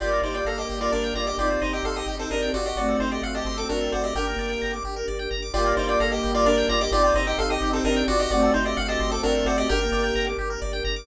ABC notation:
X:1
M:3/4
L:1/16
Q:1/4=130
K:Gm
V:1 name="Lead 1 (square)"
[Fd]2 [Ec] [Fd] [Af] [Ge]2 [Fd] [DB]2 [Fd] [Ge] | [Fd]2 [Ec] [Ge] [Af] [Ge]2 [CA] [DB]2 [Fd] [Ge] | [^Fd]2 [Ec] [Ge] =f [Ge]2 [CA] [DB]2 [^Fd] [Ge] | [Bg]6 z6 |
[Fd]2 [Ec] [Fd] [Af] [Ge]2 [Fd] [DB]2 [Fd] [Ge] | [Fd]2 [Ec] [Ge] [Af] [Ge]2 [CA] [DB]2 [Fd] [Ge] | [^Fd]2 [Ec] [Ge] =f [Ge]2 [CA] [DB]2 [^Fd] [Ge] | [Bg]6 z6 |]
V:2 name="Flute"
[G,B,]12 | [CE]12 | [A,C]12 | D B,5 z6 |
[G,B,]12 | [CE]12 | [A,C]12 | D B,5 z6 |]
V:3 name="Lead 1 (square)"
G B d g b d' G B d g b d' | G c e g c' e' G c e g ^F2- | ^F A c d ^f a c' d' F A c d | G B d g b d' G B d g b d' |
G B d g b d' G B d g b d' | G c e g c' e' G c e g ^F2- | ^F A c d ^f a c' d' F A c d | G B d g b d' G B d g b d' |]
V:4 name="Synth Bass 1" clef=bass
G,,,2 G,,,2 G,,,2 G,,,2 G,,,2 G,,,2 | G,,,2 G,,,2 G,,,2 G,,,2 G,,,2 G,,,2 | G,,,2 G,,,2 G,,,2 G,,,2 G,,,2 G,,,2 | G,,,2 G,,,2 G,,,2 G,,,2 G,,,2 G,,,2 |
G,,,2 G,,,2 G,,,2 G,,,2 G,,,2 G,,,2 | G,,,2 G,,,2 G,,,2 G,,,2 G,,,2 G,,,2 | G,,,2 G,,,2 G,,,2 G,,,2 G,,,2 G,,,2 | G,,,2 G,,,2 G,,,2 G,,,2 G,,,2 G,,,2 |]
V:5 name="String Ensemble 1"
[B,DG]12 | [CEG]12 | [CD^FA]12 | [DGB]12 |
[B,DG]12 | [CEG]12 | [CD^FA]12 | [DGB]12 |]